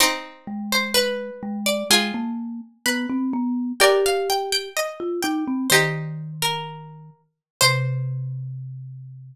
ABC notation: X:1
M:2/2
L:1/8
Q:1/2=63
K:Cm
V:1 name="Harpsichord"
c3 c =B3 d | a5 z3 | g f g g3 g2 | c3 B4 z |
c8 |]
V:2 name="Pizzicato Strings"
[CE]4 =B4 | [FA]4 =B4 | [Bd]4 e4 | [EG]6 z2 |
c8 |]
V:3 name="Marimba"
z2 A,4 A,2 | A, B,2 z =B, C B,2 | G4 z F E C | E,7 z |
C,8 |]